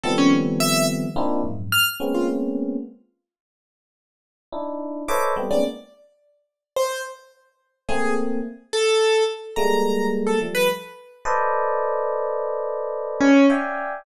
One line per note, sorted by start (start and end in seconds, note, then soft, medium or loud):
0.04 1.05 D#3 loud
0.04 1.05 F3 loud
0.04 1.05 G3 loud
0.04 1.05 A3 loud
0.04 1.05 B3 loud
0.04 1.05 C4 loud
0.04 0.16 A4 medium
0.18 0.30 C#4 loud
0.60 0.85 E5 loud
1.16 1.41 A#3 loud
1.16 1.41 C4 loud
1.16 1.41 D4 loud
1.16 1.41 D#4 loud
1.16 1.41 E4 loud
1.16 1.41 F4 loud
1.44 1.69 F2 medium
1.44 1.69 F#2 medium
1.44 1.69 G#2 medium
1.72 1.85 F6 loud
2.00 2.76 G#3 medium
2.00 2.76 A#3 medium
2.00 2.76 B3 medium
2.00 2.76 C4 medium
2.00 2.76 C#4 medium
2.14 2.27 F4 medium
4.52 5.03 D4 medium
4.52 5.03 D#4 medium
4.52 5.03 E4 medium
5.08 5.34 A4 medium
5.08 5.34 B4 medium
5.08 5.34 C5 medium
5.08 5.34 C#5 medium
5.08 5.34 D#5 medium
5.08 5.34 E5 medium
5.08 5.21 D6 medium
5.36 5.49 G3 medium
5.36 5.49 A3 medium
5.36 5.49 B3 medium
5.36 5.49 C4 medium
5.51 5.63 G#3 medium
5.51 5.63 A#3 medium
5.51 5.63 B3 medium
5.51 5.63 C4 medium
5.51 5.63 C#4 medium
5.51 5.63 D#4 medium
5.51 5.63 D5 medium
6.76 7.02 C5 medium
7.89 8.39 A3 loud
7.89 8.39 A#3 loud
7.89 8.39 C4 loud
7.89 8.14 G#4 medium
8.73 9.23 A4 medium
9.56 10.33 G3 loud
9.56 10.33 G#3 loud
9.56 10.33 A3 loud
9.56 10.33 A#3 loud
9.56 10.07 A#5 medium
10.27 10.39 A4 medium
10.41 10.66 F3 medium
10.41 10.66 G3 medium
10.41 10.66 A3 medium
10.55 10.67 B4 loud
11.25 13.27 A4 loud
11.25 13.27 B4 loud
11.25 13.27 C5 loud
11.25 13.27 D5 loud
11.25 13.27 D#5 loud
13.21 13.46 C#4 loud
13.50 14.00 D5 medium
13.50 14.00 E5 medium
13.50 14.00 F5 medium
13.50 14.00 G5 medium
13.50 14.00 G#5 medium